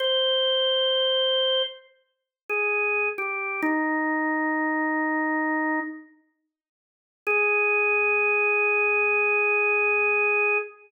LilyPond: \new Staff { \time 4/4 \key aes \major \tempo 4 = 66 c''2 r8. aes'8. g'8 | ees'2~ ees'8 r4. | aes'1 | }